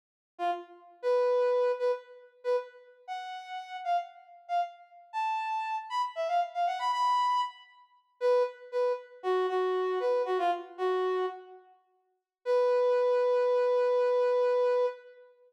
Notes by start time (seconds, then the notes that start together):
0.38 F4
1.02 B4
1.79 B4
2.44 B4
3.07 F#5
3.84 F5
4.48 F5
5.13 A5
5.90 B5
6.15 E5
6.28 F5
6.54 F5
6.67 F#5
6.79 B5
6.92 B5
8.21 B4
8.72 B4
9.23 F#4
9.49 F#4
10.00 B4
10.25 F#4
10.38 F4
10.78 F#4
12.45 B4